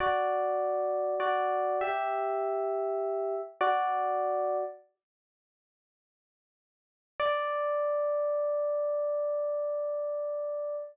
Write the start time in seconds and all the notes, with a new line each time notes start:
0.00 F#4 D5
1.20 F#4 D5
1.81 G4 E5
3.61 F#4 D5
7.20 D5